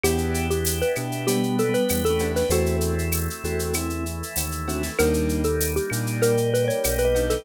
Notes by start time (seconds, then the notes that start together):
0.04 E2 B3 D4 E4 G4, cowbell, claves, shaker
0.18 shaker
0.34 shaker
0.50 G4, shaker
0.65 tambourine, shaker
0.82 B4, shaker
0.95 B2 B3 D4 E4 G4, claves, shaker
1.12 shaker
1.27 G3 B3 D4 G4 B4, cowbell, shaker
1.43 shaker
1.59 A4, shaker
1.69 G3 B3
1.74 B4, shaker
1.89 E2, tambourine, cowbell, claves, shaker
2.05 A4, shaker
2.10 A3 C#4
2.19 B3 D4 E4 G4, cowbell, shaker
2.36 B4, snare, shaker
2.49 E2 A3 C4 E4 F#4 A4 C5, cowbell, shaker
2.66 shaker
2.81 shaker
2.99 shaker
3.12 tambourine, claves, shaker
3.30 shaker
3.44 E2 A3 C4 E4 F#4 A4, shaker
3.59 shaker
3.73 E3 A3 C4 E4, cowbell, claves, shaker
3.90 shaker
4.06 shaker
4.23 shaker
4.36 D#2, tambourine, cowbell, shaker
4.52 shaker
4.68 A3 C4 D4 E4 F#4, cowbell, shaker
4.83 snare, shaker
4.99 D#2 G3 A#3 D4 D#4 A#4, cowbell, claves, shaker
5.14 shaker
5.29 shaker
5.44 A4, shaker
5.60 tambourine, shaker
5.76 G4, shaker
5.90 A#2 G3 A#3 D4 D#4, claves, shaker
6.07 shaker
6.22 G3 A#3 D#4 G4 A#4 D5, cowbell, shaker
6.37 shaker
6.54 B4, shaker
6.64 A#4 C#5 D5
6.70 shaker
6.84 B1, tambourine, cowbell, claves, shaker
6.98 B4, shaker
7.05 B4 D#5
7.15 G3 A#3 D4 D#4, cowbell, shaker
7.30 A4, snare, shaker